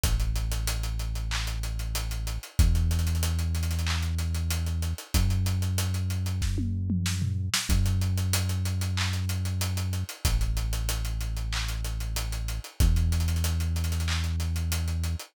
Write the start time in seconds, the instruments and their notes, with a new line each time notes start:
0.03 synth bass 1 A1, kick, closed hi-hat
0.20 closed hi-hat
0.36 closed hi-hat
0.51 closed hi-hat
0.67 closed hi-hat
0.83 closed hi-hat
0.99 closed hi-hat
1.15 closed hi-hat
1.31 clap
1.47 closed hi-hat
1.63 closed hi-hat
1.79 closed hi-hat
1.95 closed hi-hat
2.11 closed hi-hat
2.27 closed hi-hat
2.43 closed hi-hat
2.59 synth bass 1 E2, kick, closed hi-hat
2.75 closed hi-hat
2.91 snare, closed hi-hat
2.99 closed hi-hat
3.07 closed hi-hat
3.15 closed hi-hat
3.23 closed hi-hat
3.39 closed hi-hat
3.55 closed hi-hat
3.63 closed hi-hat
3.71 snare, closed hi-hat
3.79 closed hi-hat
3.87 clap
4.03 closed hi-hat
4.18 snare, closed hi-hat
4.34 closed hi-hat
4.50 closed hi-hat
4.66 closed hi-hat
4.82 closed hi-hat
4.98 closed hi-hat
5.14 synth bass 1 F#2, kick, closed hi-hat
5.30 closed hi-hat
5.46 closed hi-hat
5.62 closed hi-hat
5.78 closed hi-hat
5.94 closed hi-hat
6.10 closed hi-hat
6.26 closed hi-hat
6.42 kick, snare
6.58 high tom
6.90 mid tom
7.06 snare
7.22 floor tom
7.54 snare
7.69 synth bass 1 F#2, kick, closed hi-hat
7.86 closed hi-hat
8.01 closed hi-hat
8.17 closed hi-hat
8.33 closed hi-hat
8.49 closed hi-hat
8.65 closed hi-hat
8.81 closed hi-hat
8.97 clap
9.13 snare, closed hi-hat
9.29 closed hi-hat
9.45 closed hi-hat
9.61 closed hi-hat
9.77 closed hi-hat
9.93 closed hi-hat
10.09 closed hi-hat
10.25 synth bass 1 A1, kick, closed hi-hat
10.41 closed hi-hat
10.57 closed hi-hat
10.73 closed hi-hat
10.89 closed hi-hat
11.05 closed hi-hat
11.20 closed hi-hat
11.37 closed hi-hat
11.53 clap
11.68 closed hi-hat
11.84 closed hi-hat
12.00 closed hi-hat
12.16 closed hi-hat
12.32 closed hi-hat
12.48 closed hi-hat
12.64 closed hi-hat
12.80 synth bass 1 E2, kick, closed hi-hat
12.96 closed hi-hat
13.12 snare, closed hi-hat
13.20 closed hi-hat
13.28 closed hi-hat
13.36 closed hi-hat
13.44 closed hi-hat
13.60 closed hi-hat
13.76 closed hi-hat
13.84 closed hi-hat
13.92 snare, closed hi-hat
14.00 closed hi-hat
14.08 clap
14.24 closed hi-hat
14.40 snare, closed hi-hat
14.56 closed hi-hat
14.72 closed hi-hat
14.88 closed hi-hat
15.03 closed hi-hat
15.19 closed hi-hat